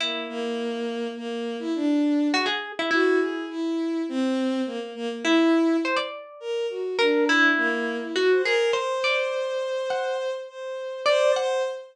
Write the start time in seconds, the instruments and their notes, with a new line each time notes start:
0.00 violin A#3, orchestral harp E4
0.29 violin A#3
1.17 violin A#3
1.59 violin E4
1.75 violin D4
2.33 orchestral harp F#4, violin G#4
2.46 orchestral harp G#4
2.79 orchestral harp E4
2.91 orchestral harp E4, violin F#4
3.20 violin G#4
3.50 violin E4
4.09 violin C4
4.66 violin A#3
4.80 violin A#3
4.95 violin A#3
5.10 violin A#3
5.24 violin E4, orchestral harp E4
5.85 orchestral harp C5
5.96 orchestral harp D5
6.40 violin A#4
6.70 violin F#4
6.99 violin D4, orchestral harp A#4
7.29 orchestral harp E4
7.58 violin A#3
8.01 violin E4
8.16 orchestral harp F#4, violin F#4
8.30 violin C5
8.44 orchestral harp G#4, violin A#4
8.73 violin C5, orchestral harp C5
9.04 orchestral harp D5
9.90 orchestral harp F#5
10.49 violin C5
11.06 violin C5, orchestral harp D5
11.36 violin C5, orchestral harp F#5